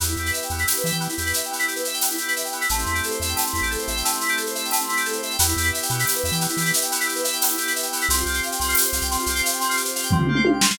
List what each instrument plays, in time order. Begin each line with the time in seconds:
0.00 synth bass 1 E2, electric piano 2 B3, drawbar organ B3 E4 G4, shaker
0.08 electric piano 2 E4, shaker
0.16 synth bass 1 E2, electric piano 2 G4, shaker
0.26 electric piano 2 B4, shaker
0.33 electric piano 2 E5, shaker
0.42 electric piano 2 G5, shaker
0.50 synth bass 1 E2, electric piano 2 B3, shaker
0.58 electric piano 2 E4, shaker
0.67 electric piano 2 G4, tambourine, shaker
0.76 electric piano 2 B4, shaker
0.84 synth bass 1 E3, electric piano 2 E5, shaker
0.92 synth bass 1 E3, electric piano 2 G5, shaker
1.00 electric piano 2 B3, shaker
1.09 electric piano 2 E4, shaker
1.17 synth bass 1 E2, electric piano 2 G4, shaker
1.26 electric piano 2 B4, shaker
1.33 electric piano 2 E5, shaker
1.43 electric piano 2 G5, shaker
1.51 electric piano 2 B3, shaker
1.59 electric piano 2 E4, shaker
1.68 electric piano 2 G4, shaker
1.76 electric piano 2 B4, shaker
1.85 electric piano 2 E5, shaker
1.94 electric piano 2 G5, shaker
2.01 electric piano 2 B3, tambourine, shaker
2.10 electric piano 2 E4, shaker
2.18 electric piano 2 G4, shaker
2.28 electric piano 2 B4, shaker
2.36 electric piano 2 E5, shaker
2.44 electric piano 2 G5, shaker
2.52 electric piano 2 B3, shaker
2.61 electric piano 2 E4, shaker
2.69 synth bass 1 A1, drawbar organ A3 C4 E4 G4, electric piano 2 A3, shaker
2.79 electric piano 2 C4, shaker
2.86 synth bass 1 E2, electric piano 2 E4, shaker
2.94 electric piano 2 G4, shaker
3.03 electric piano 2 A4, shaker
3.10 electric piano 2 C5, shaker
3.20 synth bass 1 E2, electric piano 2 E5, shaker
3.28 electric piano 2 G5, shaker
3.36 electric piano 2 A3, tambourine, shaker
3.45 electric piano 2 C4, shaker
3.52 synth bass 1 E2, electric piano 2 E4, shaker
3.62 synth bass 1 A1, electric piano 2 G4, shaker
3.71 electric piano 2 A4, shaker
3.78 electric piano 2 C5, shaker
3.87 synth bass 1 A1, electric piano 2 E5, shaker
3.96 electric piano 2 G5, shaker
4.04 electric piano 2 A3, shaker
4.13 electric piano 2 C4, shaker
4.21 electric piano 2 E4, shaker
4.28 electric piano 2 G4, shaker
4.37 electric piano 2 A4, shaker
4.46 electric piano 2 C5, shaker
4.55 electric piano 2 E5, shaker
4.65 electric piano 2 G5, shaker
4.71 electric piano 2 A3, tambourine, shaker
4.80 electric piano 2 C4, shaker
4.88 electric piano 2 E4, shaker
4.97 electric piano 2 G4, shaker
5.05 electric piano 2 A4, shaker
5.13 electric piano 2 C5, shaker
5.23 electric piano 2 E5, shaker
5.31 electric piano 2 G5, shaker
5.39 synth bass 1 E2, electric piano 2 B3, drawbar organ B3 E4 G4, shaker
5.48 electric piano 2 E4, shaker
5.56 synth bass 1 E2, electric piano 2 G4, shaker
5.64 electric piano 2 B4, shaker
5.73 electric piano 2 E5, shaker
5.82 electric piano 2 G5, shaker
5.89 synth bass 1 B2, electric piano 2 B3, shaker
5.99 electric piano 2 E4, shaker
6.05 electric piano 2 G4, tambourine, shaker
6.16 electric piano 2 B4, shaker
6.24 synth bass 1 E2, electric piano 2 E5, shaker
6.32 synth bass 1 E3, electric piano 2 G5, shaker
6.41 electric piano 2 B3, shaker
6.49 electric piano 2 E4, shaker
6.57 synth bass 1 E3, electric piano 2 G4, shaker
6.65 electric piano 2 B4, shaker
6.73 electric piano 2 E5, shaker
6.81 electric piano 2 G5, shaker
6.92 electric piano 2 B3, shaker
7.00 electric piano 2 E4, shaker
7.07 electric piano 2 G4, shaker
7.15 electric piano 2 B4, shaker
7.24 electric piano 2 E5, shaker
7.32 electric piano 2 G5, shaker
7.41 electric piano 2 B3, tambourine, shaker
7.48 electric piano 2 E4, shaker
7.58 electric piano 2 G4, shaker
7.67 electric piano 2 B4, shaker
7.75 electric piano 2 E5, shaker
7.82 electric piano 2 G5, shaker
7.92 electric piano 2 B3, shaker
8.01 electric piano 2 E4, shaker
8.09 synth bass 1 C2, drawbar organ C4 F4 G4, electric piano 2 C4, shaker
8.17 electric piano 2 F4, shaker
8.26 synth bass 1 C2, electric piano 2 G4, shaker
8.34 electric piano 2 C5, shaker
8.43 electric piano 2 F5, shaker
8.51 electric piano 2 G5, shaker
8.59 synth bass 1 C2, electric piano 2 C4, shaker
8.68 electric piano 2 F4, shaker
8.75 electric piano 2 G4, tambourine, shaker
8.84 electric piano 2 C5, shaker
8.93 synth bass 1 C2, electric piano 2 F5, shaker
9.01 synth bass 1 C2, electric piano 2 G5, shaker
9.11 electric piano 2 C4, shaker
9.18 electric piano 2 F4, shaker
9.26 synth bass 1 C2, electric piano 2 G4, shaker
9.35 electric piano 2 C5, shaker
9.43 electric piano 2 F5, shaker
9.52 electric piano 2 G5, shaker
9.59 electric piano 2 C4, shaker
9.69 electric piano 2 F4, shaker
9.76 electric piano 2 G4, shaker
9.84 electric piano 2 C5, shaker
9.95 electric piano 2 F5, shaker
10.03 electric piano 2 G5, shaker
10.11 electric piano 2 C4, kick, floor tom
10.18 electric piano 2 F4, floor tom
10.27 electric piano 2 G4, mid tom
10.35 electric piano 2 C5, mid tom
10.45 electric piano 2 F5, high tom
10.53 electric piano 2 G5
10.61 electric piano 2 C4, snare
10.68 electric piano 2 F4, snare